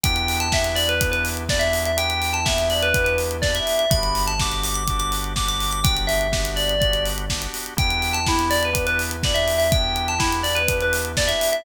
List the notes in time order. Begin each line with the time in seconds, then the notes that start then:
0.04 E2 B3 D4 E4 G4 G5, kick, closed hi-hat
0.16 closed hi-hat
0.28 open hi-hat
0.40 A5, closed hi-hat
0.52 B3 D4 E4 G4 E5, kick, snare
0.64 closed hi-hat
0.76 D5, open hi-hat
0.89 B4, closed hi-hat
1.01 B3 D4 E4 G4, kick, closed hi-hat
1.12 B4, closed hi-hat
1.25 open hi-hat
1.37 closed hi-hat
1.48 B3 D4 E4 G4 D5, kick, snare
1.59 E5, closed hi-hat
1.73 open hi-hat
1.85 E5, closed hi-hat
1.97 B3 D4 E4 G4 G5, closed hi-hat
2.10 closed hi-hat
2.22 open hi-hat
2.33 A5, closed hi-hat
2.45 B3 D4 E4 G4 E5, kick, snare
2.58 closed hi-hat
2.70 D5, open hi-hat
2.82 B4, closed hi-hat
2.94 B3 D4 E4 G4, kick, closed hi-hat
3.04 B4, closed hi-hat
3.18 open hi-hat
3.31 closed hi-hat
3.42 B3 D4 E4 G4 D5, kick, snare
3.55 E5, closed hi-hat
3.67 open hi-hat
3.79 E5, closed hi-hat
3.90 G1 B3 D4 F#4 G4 B5, kick, closed hi-hat
4.03 closed hi-hat
4.15 open hi-hat
4.27 A5, closed hi-hat
4.39 B3 D4 F#4 G4 D6, kick, snare
4.52 closed hi-hat
4.64 D6, open hi-hat
4.74 D6, closed hi-hat
4.88 B3 D4 F#4 G4, kick, closed hi-hat
4.99 D6, closed hi-hat
5.12 open hi-hat
5.24 closed hi-hat
5.36 B3 D4 F#4 G4 D6, kick, snare
5.48 D6, closed hi-hat
5.60 open hi-hat
5.71 D6, closed hi-hat
5.84 B3 D4 F#4 G4 G5, kick, closed hi-hat
5.97 closed hi-hat
6.07 E5, open hi-hat
6.21 closed hi-hat
6.32 B3 D4 F#4 G4, kick, snare
6.45 closed hi-hat
6.56 D5, open hi-hat
6.69 closed hi-hat
6.80 B3 D4 F#4 G4 D5, kick, closed hi-hat
6.93 closed hi-hat
7.06 open hi-hat
7.18 closed hi-hat
7.30 B3 D4 F#4 G4, kick, snare
7.42 closed hi-hat
7.54 open hi-hat
7.66 closed hi-hat
7.77 E2 B3 D4 E4 G4 G5, kick, closed hi-hat
7.90 closed hi-hat
8.02 open hi-hat
8.13 A5, closed hi-hat
8.26 B3 D4 E4 G4, kick, snare
8.39 closed hi-hat
8.50 D5, open hi-hat
8.63 B4, closed hi-hat
8.73 B3 D4 E4 G4, kick, closed hi-hat
8.87 B4, closed hi-hat
8.99 open hi-hat
9.11 closed hi-hat
9.23 B3 D4 E4 G4 D5, kick, snare
9.34 E5, closed hi-hat
9.48 open hi-hat
9.58 E5, open hi-hat
9.71 B3 D4 E4 G4 G5, kick, closed hi-hat
9.96 closed hi-hat
10.08 A5, closed hi-hat
10.18 B3 D4 E4 G4, kick, snare
10.32 closed hi-hat
10.43 D5, open hi-hat
10.55 B4, closed hi-hat
10.68 B3 D4 E4 G4, kick, closed hi-hat
10.81 B4, closed hi-hat
10.93 open hi-hat
11.05 closed hi-hat
11.17 B3 D4 E4 G4 D5, kick, snare
11.28 E5, closed hi-hat
11.41 open hi-hat
11.52 E5, closed hi-hat